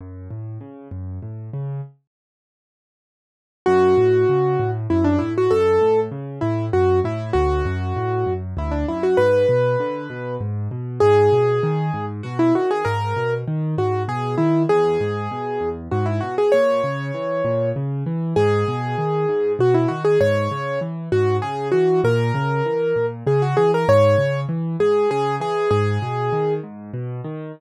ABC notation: X:1
M:3/4
L:1/16
Q:1/4=98
K:F#m
V:1 name="Acoustic Grand Piano"
z12 | z12 | F8 E D E F | A4 z2 E2 F2 E2 |
F8 E D E F | B8 z4 | [K:G#m] G8 F E F G | A4 z2 F2 G2 E2 |
G8 F E F G | c8 z4 | G8 F E F G | c4 z2 F2 G2 F2 |
A8 G F G A | c4 z2 G2 G2 G2 | G6 z6 |]
V:2 name="Acoustic Grand Piano" clef=bass
F,,2 A,,2 C,2 F,,2 A,,2 C,2 | z12 | F,,2 A,,2 C,2 A,,2 F,,2 A,,2 | F,,2 A,,2 C,2 A,,2 F,,2 A,,2 |
D,,2 F,,2 A,,2 F,,2 D,,2 F,,2 | G,,2 B,,2 D,2 B,,2 G,,2 B,,2 | [K:G#m] G,,2 B,,2 D,2 G,,2 B,,2 D,2 | G,,2 B,,2 D,2 G,,2 B,,2 D,2 |
E,,2 G,,2 B,,2 E,,2 G,,2 B,,2 | A,,2 C,2 E,2 A,,2 C,2 E,2 | G,,2 B,,2 D,2 G,,2 B,,2 D,2 | G,,2 C,2 E,2 G,,2 C,2 E,2 |
A,,2 C,2 E,2 A,,2 C,2 E,2 | G,,2 C,2 E,2 G,,2 C,2 E,2 | G,,2 B,,2 D,2 G,,2 B,,2 D,2 |]